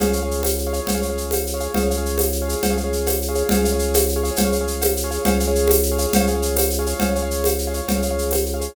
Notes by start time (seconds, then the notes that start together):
0.00 C#2 G#4 C#5 F5, cowbell, low conga, shaker
0.07 G#4 C#5 F5
0.13 G#4 C#5 F5, shaker
0.23 G#4 C#5 F5
0.31 shaker
0.43 tambourine, cowbell, high conga, shaker
0.58 shaker
0.67 G#4 C#5 F5
0.73 G#4 C#5 F5, shaker
0.87 C#2, cowbell, low conga, shaker
0.95 G#4 C#5 F5
1.02 G#4 C#5 F5, shaker
1.10 G#4 C#5 F5
1.18 shaker
1.31 tambourine, cowbell, high conga, shaker
1.47 shaker
1.54 G#4 C#5 F5
1.60 G#4 C#5 F5, shaker
1.74 C#2 G#4 C#5 F5, cowbell, low conga, shaker
1.83 G#4 C#5 F5
1.90 G#4 C#5 F5, shaker
1.97 G#4 C#5 F5
2.06 shaker
2.18 tambourine, cowbell, high conga, shaker
2.32 shaker
2.42 G#4 C#5 F5
2.48 G#4 C#5 F5, shaker
2.63 C#2, cowbell, low conga, shaker
2.70 G#4 C#5 F5
2.77 G#4 C#5 F5, shaker
2.84 G#4 C#5 F5
2.93 shaker
3.06 tambourine, cowbell, high conga, shaker
3.22 shaker
3.28 G#4 C#5 F5
3.35 G#4 C#5 F5, shaker
3.49 C#2 G#4 C#5 F5, cowbell, low conga, shaker
3.57 G#4 C#5 F5
3.64 G#4 C#5 F5, shaker
3.73 G#4 C#5 F5
3.79 shaker
3.94 tambourine, cowbell, high conga, shaker
4.09 shaker
4.16 G#4 C#5 F5
4.24 G#4 C#5 F5, shaker
4.36 C#2, cowbell, low conga, shaker
4.45 G#4 C#5 F5
4.52 G#4 C#5 F5, shaker
4.61 G#4 C#5 F5
4.67 shaker
4.81 tambourine, cowbell, high conga, shaker
4.97 shaker
5.04 G#4 C#5 F5
5.11 G#4 C#5 F5, shaker
5.25 C#2 G#4 C#5 F5, cowbell, low conga, shaker
5.32 G#4 C#5 F5
5.40 G#4 C#5 F5, shaker
5.47 G#4 C#5 F5
5.55 shaker
5.68 tambourine, cowbell, high conga, shaker
5.83 shaker
5.91 G#4 C#5 F5
5.98 G#4 C#5 F5, shaker
6.13 C#2, cowbell, low conga, shaker
6.20 G#4 C#5 F5
6.27 G#4 C#5 F5, shaker
6.35 G#4 C#5 F5
6.42 shaker
6.56 tambourine, cowbell, high conga, shaker
6.70 shaker
6.79 G#4 C#5 F5
6.86 G#4 C#5 F5, shaker
7.00 C#2 G#4 C#5 F5, cowbell, low conga, shaker
7.09 G#4 C#5 F5
7.15 G#4 C#5 F5, shaker
7.22 G#4 C#5 F5
7.31 shaker
7.44 tambourine, cowbell, high conga, shaker
7.59 shaker
7.67 G#4 C#5 F5
7.74 G#4 C#5 F5, shaker
7.88 C#2, cowbell, low conga, shaker
7.96 G#4 C#5 F5
8.02 G#4 C#5 F5, shaker
8.11 G#4 C#5 F5
8.18 shaker
8.31 tambourine, cowbell, high conga, shaker
8.46 shaker
8.54 G#4 C#5 F5
8.61 G#4 C#5 F5, shaker